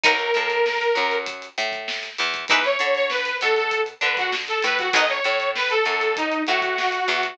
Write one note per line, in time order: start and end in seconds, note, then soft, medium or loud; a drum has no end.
0.04 0.32 B1 medium
0.04 0.14 D#4 loud
0.04 0.14 F#4 loud
0.04 1.16 A#4 medium
0.04 0.14 A#4 loud
0.04 0.14 B4 loud
0.04 kick loud
0.04 closed hi-hat medium
0.19 snare soft
0.19 closed hi-hat medium
0.34 0.89 A2 medium
0.34 0.86 A3 medium
0.34 closed hi-hat medium
0.50 snare soft
0.50 closed hi-hat medium
0.66 snare medium
0.81 snare soft
0.81 closed hi-hat medium
0.95 1.49 F#2 medium
0.95 1.47 F#3 medium
0.95 closed hi-hat medium
1.11 closed hi-hat medium
1.26 kick medium
1.26 closed hi-hat medium
1.42 closed hi-hat medium
1.58 2.10 A2 medium
1.58 2.10 A3 medium
1.58 closed hi-hat medium
1.72 kick medium
1.72 snare soft
1.72 closed hi-hat medium
1.88 snare loud
2.03 closed hi-hat medium
2.18 2.46 E2 medium
2.18 2.45 E3 medium
2.18 closed hi-hat medium
2.34 kick medium
2.34 closed hi-hat medium
2.48 2.77 E2 loud
2.48 2.60 D#4 loud
2.48 2.60 E4 loud
2.48 2.60 G#4 loud
2.48 2.63 B4 medium
2.48 2.60 B4 loud
2.48 kick loud
2.48 closed hi-hat medium
2.64 2.94 C#5 medium
2.64 closed hi-hat medium
2.79 3.33 D3 medium
2.79 3.32 D4 medium
2.79 closed hi-hat medium
2.95 3.09 C#5 medium
2.95 closed hi-hat medium
3.09 3.37 B4 medium
3.09 snare medium
3.25 closed hi-hat medium
3.41 3.94 B2 medium
3.41 3.93 B3 medium
3.41 3.56 A4 medium
3.41 closed hi-hat medium
3.56 3.81 A4 medium
3.56 closed hi-hat medium
3.71 kick medium
3.71 closed hi-hat medium
3.86 closed hi-hat medium
4.01 4.54 D3 medium
4.01 4.53 D4 medium
4.01 4.16 B4 medium
4.01 closed hi-hat medium
4.17 4.32 F#4 medium
4.17 kick medium
4.17 closed hi-hat medium
4.32 snare medium
4.48 4.63 A4 medium
4.48 closed hi-hat medium
4.63 4.90 A2 medium
4.63 4.90 A3 medium
4.63 4.78 B4 medium
4.63 closed hi-hat medium
4.78 4.93 F#4 medium
4.78 kick medium
4.78 closed hi-hat medium
4.93 5.20 B1 loud
4.93 5.05 D#4 loud
4.93 5.05 F#4 loud
4.93 5.05 A#4 loud
4.93 5.05 B4 loud
4.93 5.08 D#5 medium
4.93 kick medium
4.93 closed hi-hat loud
5.09 5.23 C#5 medium
5.09 closed hi-hat medium
5.24 5.77 A2 medium
5.24 5.76 A3 medium
5.24 5.49 C#5 medium
5.24 closed hi-hat medium
5.40 closed hi-hat medium
5.55 5.70 B4 medium
5.55 snare medium
5.70 6.14 A4 medium
5.70 closed hi-hat medium
5.85 6.38 F#2 medium
5.85 6.38 F#3 medium
5.85 closed hi-hat medium
6.01 closed hi-hat medium
6.16 6.42 D#4 medium
6.16 kick medium
6.16 closed hi-hat medium
6.32 closed hi-hat medium
6.47 7.00 A2 medium
6.47 7.00 A3 medium
6.47 7.35 F#4 medium
6.47 snare soft
6.47 closed hi-hat medium
6.62 kick medium
6.62 closed hi-hat medium
6.78 snare medium
6.92 closed hi-hat medium
7.08 7.34 E2 medium
7.08 7.34 E3 medium
7.08 closed hi-hat medium
7.23 kick medium
7.23 closed hi-hat medium